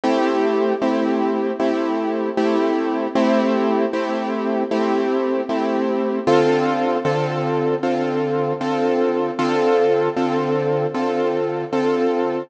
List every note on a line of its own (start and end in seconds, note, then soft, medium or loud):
0.04 0.74 A3 medium
0.04 0.74 C4 medium
0.04 0.74 E4 medium
0.04 0.74 G4 medium
0.81 1.52 A3 medium
0.81 1.52 C4 medium
0.81 1.52 E4 medium
0.81 1.52 G4 medium
1.59 2.30 A3 medium
1.59 2.30 C4 medium
1.59 2.30 E4 medium
1.59 2.30 G4 medium
2.37 3.07 A3 medium
2.37 3.07 C4 medium
2.37 3.07 E4 medium
2.37 3.07 G4 medium
3.15 3.85 A3 medium
3.15 3.85 C4 loud
3.15 3.85 E4 medium
3.15 3.85 G4 medium
3.93 4.63 A3 medium
3.93 4.63 C4 medium
3.93 4.63 E4 medium
3.93 4.63 G4 medium
4.71 5.41 A3 medium
4.71 5.41 C4 medium
4.71 5.41 E4 medium
4.71 5.41 G4 medium
5.49 6.19 A3 medium
5.49 6.19 C4 medium
5.49 6.19 E4 medium
5.49 6.19 G4 medium
6.27 6.97 D3 medium
6.27 6.97 C4 medium
6.27 6.97 F4 loud
6.27 6.97 A4 medium
7.05 7.75 D3 medium
7.05 7.75 C4 medium
7.05 7.75 F4 medium
7.05 7.75 A4 medium
7.83 8.53 D3 medium
7.83 8.53 C4 medium
7.83 8.53 F4 medium
7.83 8.53 A4 medium
8.61 9.31 D3 medium
8.61 9.31 C4 medium
8.61 9.31 F4 medium
8.61 9.31 A4 medium
9.39 10.09 D3 medium
9.39 10.09 C4 medium
9.39 10.09 F4 medium
9.39 10.09 A4 medium
10.16 10.87 D3 medium
10.16 10.87 C4 medium
10.16 10.87 F4 medium
10.16 10.87 A4 medium
10.94 11.64 D3 medium
10.94 11.64 C4 medium
10.94 11.64 F4 medium
10.94 11.64 A4 medium
11.73 12.43 D3 medium
11.73 12.43 C4 medium
11.73 12.43 F4 medium
11.73 12.43 A4 medium